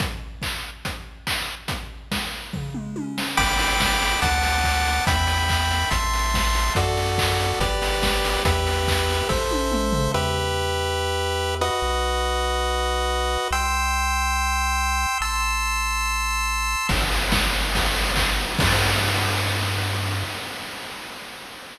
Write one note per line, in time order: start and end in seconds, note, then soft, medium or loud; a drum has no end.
0.00 kick medium
0.00 closed hi-hat medium
0.42 kick medium
0.42 clap medium
0.85 kick medium
0.85 closed hi-hat medium
1.27 kick medium
1.27 clap loud
1.68 kick medium
1.68 closed hi-hat medium
2.12 kick medium
2.12 snare medium
2.53 kick medium
2.53 floor tom medium
2.74 mid tom medium
2.96 high tom medium
3.18 snare medium
3.37 4.16 G1 medium
3.37 4.20 G5 medium
3.37 4.20 B5 medium
3.37 4.20 D6 medium
3.37 kick medium
3.37 crash medium
3.59 open hi-hat medium
3.80 kick medium
3.80 snare loud
4.02 open hi-hat medium
4.22 5.00 D2 loud
4.22 5.05 F#5 medium
4.22 5.05 A5 medium
4.22 5.05 D6 medium
4.22 kick medium
4.22 closed hi-hat medium
4.43 open hi-hat medium
4.64 kick medium
4.64 clap medium
4.85 open hi-hat medium
5.07 5.85 E2 loud
5.07 5.90 E5 medium
5.07 5.90 G5 medium
5.07 5.90 B5 medium
5.07 kick medium
5.07 closed hi-hat medium
5.27 open hi-hat medium
5.49 kick medium
5.49 clap medium
5.71 open hi-hat medium
5.91 6.70 A1 loud
5.91 6.73 E5 medium
5.91 6.73 A5 medium
5.91 6.73 C6 medium
5.91 kick medium
5.91 closed hi-hat medium
6.13 open hi-hat medium
6.34 kick medium
6.34 snare medium
6.55 open hi-hat medium
6.75 7.54 F#2 loud
6.75 7.59 F#4 medium
6.75 7.59 A4 medium
6.75 7.59 D5 medium
6.75 kick medium
6.75 closed hi-hat medium
6.97 open hi-hat medium
7.18 kick medium
7.18 clap loud
7.39 open hi-hat medium
7.60 8.38 G1 medium
7.60 8.43 G4 medium
7.60 8.43 B4 medium
7.60 8.43 D5 medium
7.60 kick medium
7.60 closed hi-hat medium
7.82 open hi-hat medium
8.02 kick medium
8.02 snare loud
8.25 open hi-hat medium
8.45 9.23 E2 loud
8.45 9.28 G4 medium
8.45 9.28 B4 medium
8.45 9.28 E5 medium
8.45 kick medium
8.45 closed hi-hat loud
8.67 open hi-hat medium
8.88 kick medium
8.88 clap loud
9.10 open hi-hat medium
9.29 10.09 A1 medium
9.29 10.12 A4 medium
9.29 10.12 C5 medium
9.29 10.12 E5 medium
9.29 kick medium
9.29 snare medium
9.51 high tom medium
9.72 mid tom medium
9.92 floor tom medium
10.14 11.70 E2 medium
10.14 11.55 G4 medium
10.14 11.55 B4 loud
10.14 11.55 E5 medium
11.61 13.48 F#4 medium
11.61 13.48 B4 medium
11.61 13.48 D#5 medium
11.82 13.38 B1 medium
13.51 15.06 C2 medium
13.51 15.18 G5 medium
13.51 15.18 C6 medium
13.51 15.18 E6 medium
15.21 16.76 A1 medium
15.21 16.87 A5 medium
15.21 16.87 C6 medium
15.21 16.87 E6 loud
16.89 18.46 G1 loud
16.89 kick medium
16.89 crash loud
17.12 ride medium
17.32 kick medium
17.32 snare loud
17.53 ride medium
17.75 kick medium
17.75 ride medium
17.95 ride medium
18.16 kick medium
18.16 clap loud
18.39 ride medium
18.59 20.24 G2 loud
18.59 kick loud
18.59 crash loud